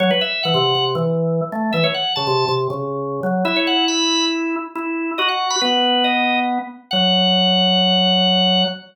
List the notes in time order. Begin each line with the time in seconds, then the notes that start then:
0.00 F#3 C#5
0.11 B4
0.21 E5
0.43 E3 F#5
0.54 C3
0.75 C3
0.95 E3
1.52 A3
1.73 E3 E5
1.84 C#5
1.94 F#5
2.16 C#3 A5
2.27 C3
2.48 C3
2.70 C#3
3.23 F#3
3.45 E4 E5
3.56 C#5
3.67 F#5
3.88 B5
4.75 E4
5.18 F#4 D#5
5.29 F#5
5.50 B5
5.61 B3 B4
6.04 D#5
6.91 F#3 F#5